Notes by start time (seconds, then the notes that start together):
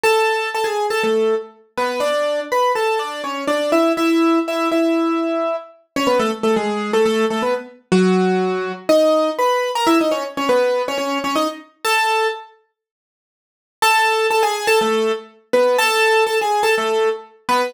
0.03 A4 A5
0.55 A4 A5
0.64 G#4 G#5
0.90 A4 A5
1.03 A3 A4
1.77 B3 B4
2.00 D4 D5
2.52 B4 B5
2.75 A4 A5
2.99 D4 D5
3.24 C#4 C#5
3.47 D4 D5
3.72 E4 E5
3.97 E4 E5
4.48 E4 E5
4.72 E4 E5
5.96 C#4 C#5
6.07 B3 B4
6.19 A3 A4
6.43 A3 A4
6.56 G#3 G#4
6.93 A3 A4
7.05 A3 A4
7.30 A3 A4
7.42 B3 B4
7.92 F#3 F#4
8.89 D#4 D#5
9.39 B4 B5
9.75 A#4 A#5
9.87 E4 E5
10.01 D#4 D#5
10.11 C#4 C#5
10.37 C#4 C#5
10.49 B3 B4
10.88 C#4 C#5
10.98 C#4 C#5
11.24 C#4 C#5
11.35 D#4 D#5
11.85 A4 A5
13.82 A4 A5
14.31 A4 A5
14.43 G#4 G#5
14.67 A4 A5
14.81 A3 A4
15.53 B3 B4
15.78 A4 A5
16.27 A4 A5
16.41 G#4 G#5
16.63 A4 A5
16.78 A3 A4
17.49 B3 B4